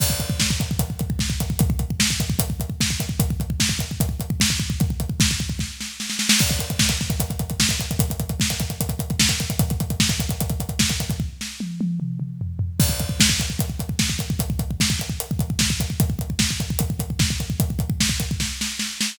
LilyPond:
\new DrumStaff \drummode { \time 4/4 \tempo 4 = 150 <cymc bd>16 bd16 <hh bd>16 bd16 <bd sn>16 bd16 <hh bd>16 bd16 <hh bd>16 bd16 <hh bd>16 bd16 <bd sn>16 bd16 <hh bd>16 bd16 | <hh bd>16 bd16 <hh bd>16 bd16 <bd sn>16 bd16 <hh bd>16 bd16 <hh bd>16 bd16 <hh bd>16 bd16 <bd sn>16 bd16 <hh bd>16 bd16 | <hh bd>16 bd16 <hh bd>16 bd16 <bd sn>16 bd16 <hh bd>16 bd16 <hh bd>16 bd16 <hh bd>16 bd16 <bd sn>16 bd16 bd16 bd16 | <hh bd>16 bd16 <hh bd>16 bd16 <bd sn>16 bd16 bd16 bd16 <bd sn>8 sn8 sn16 sn16 sn16 sn16 |
<cymc bd>16 <hh bd>16 <hh bd>16 <hh bd>16 <bd sn>16 <hh bd>16 <bd sn>16 <hh bd>16 <hh bd>16 <hh bd>16 <hh bd>16 <hh bd>16 <bd sn>16 <hh bd>16 <hh bd>16 <hh bd>16 | <hh bd>16 <hh bd>16 <hh bd>16 <hh bd>16 <bd sn>16 <hh bd>16 <hh bd>16 <hh bd>16 <hh bd>16 <hh bd>16 <hh bd>16 <hh bd>16 <bd sn>16 <hh bd>16 <hh bd>16 <hh bd>16 | <hh bd>16 <hh bd>16 <hh bd>16 <hh bd>16 <bd sn>16 <hh bd>16 <hh bd>16 <hh bd>16 <hh bd>16 <hh bd>16 <hh bd>16 <hh bd>16 <bd sn>16 <hh bd>16 <hh bd>16 <hh bd>16 | bd8 sn8 tommh8 tommh8 toml8 toml8 tomfh8 tomfh8 |
<cymc bd>16 bd16 <hh bd>16 bd16 <bd sn>16 bd16 <hh bd>16 bd16 <hh bd>16 bd16 <hh bd>16 bd16 <bd sn>16 bd16 <hh bd>16 bd16 | <hh bd>16 bd16 <hh bd>16 bd16 <bd sn>16 bd16 <hh bd>16 bd16 hh16 bd16 <hh bd>16 bd16 <bd sn>16 bd16 <hh bd>16 bd16 | <hh bd>16 bd16 <hh bd>16 bd16 <bd sn>16 bd16 <hh bd>16 bd16 <hh bd>16 bd16 <hh bd>16 bd16 <bd sn>16 bd16 <hh bd>16 bd16 | <hh bd>16 bd16 <hh bd>16 bd16 <bd sn>16 bd16 <hh bd>16 bd16 <bd sn>8 sn8 sn8 sn8 | }